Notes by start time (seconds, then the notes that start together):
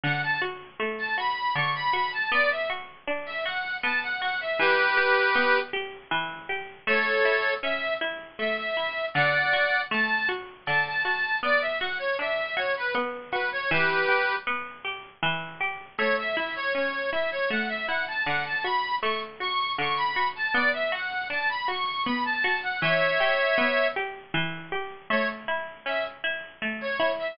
0.03 D3 F#5
0.23 A5
0.42 F#4
0.80 A3
0.99 A5
1.18 F#4 B5
1.55 D3 C#6
1.75 B5
1.93 F#4 B5
2.12 A5
2.31 B3 D5
2.51 E5
2.70 F#4
3.07 D4
3.26 E5
3.46 F#4 F#5
3.83 B3 A5
4.03 F#5
4.22 F#4 F#5
4.41 E5
4.59 E3 G4 B4
4.97 G4
5.35 B3
5.73 G4
6.11 E3
6.49 G4
6.87 A3 A4 C#5
7.25 E4
7.63 C#4 E5
8.01 E4
8.39 A3 E5
8.59 E5
8.77 E4
9.14 D3 D5 F#5
9.53 F#4
9.91 A3 A5
10.29 F#4
10.66 D3 A5
10.87 A5
11.05 F#4
11.43 B3 D5
11.61 E5
11.80 F#4 F#5
11.99 C#5
12.19 D4 E5
12.57 F#4 C#5
12.77 B4
12.95 B3
13.32 F#4 B4
13.52 C#5
13.70 E3 G4 B4
14.08 G4
14.47 B3
14.85 G4
15.23 E3
15.61 G4
15.98 A3 C#5
16.18 E5
16.36 E4 E5
16.56 C#5
16.75 C#4 C#5
17.12 E4 E5
17.31 C#5
17.50 A3 F#5
17.68 E5
17.87 E4 F#5
18.08 A5
18.26 D3 F#5
18.45 A5
18.63 F#4 B5
19.02 A3 C#6
19.40 F#4 C#6
19.78 D3 C#6
19.97 B5
20.16 F#4
20.36 A5
20.53 B3 D5
20.73 E5
20.92 F#4 F#5
21.30 D4 A5
21.49 B5
21.68 F#4 C#6
22.05 B3 B5
22.25 A5
22.44 F#4
22.63 F#5
22.81 E3 C#5 E5
23.20 G4
23.58 B3
23.96 G4
24.34 E3
24.72 G4
25.10 A3 C#5
25.48 E4
25.86 C#4 E5
26.24 E4
26.62 A3
26.81 C#5
27.00 E4
27.19 E5